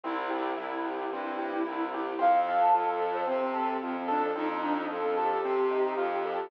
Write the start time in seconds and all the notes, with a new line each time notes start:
0.03 C2 C4 E4
0.30 G4
0.57 C2 E4
0.86 G4
1.12 G2 C4
1.39 G4
1.65 C2 E4
1.94 G4
2.19 F2 C4 F5
2.48 A4
2.61 A5
2.72 F2 F4 A4
3.02 A4
3.14 C5
3.27 C3 C4
3.54 A4
3.82 F2 F4
4.08 D4 A4
4.36 F2 C4 D#4
4.51 D#4
4.62 D4 D#4
4.78 C4
4.90 F2 F4 A4
5.17 G4 A4
5.44 C3 C4
5.71 D#4
5.98 F2 F4
6.25 A4